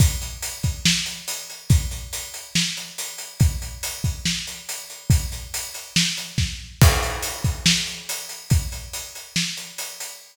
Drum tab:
CC |--------|--------|--------|--------|
HH |xxxx-xxx|xxxx-xxx|xxxx-xxx|xxxx-x--|
SD |----o---|----o---|----o---|----o-o-|
BD |o--o----|o-------|o--o----|o-----o-|

CC |x-------|--------|
HH |-xxx-xxx|xxxx-xxx|
SD |----o---|----o---|
BD |o--o----|o-------|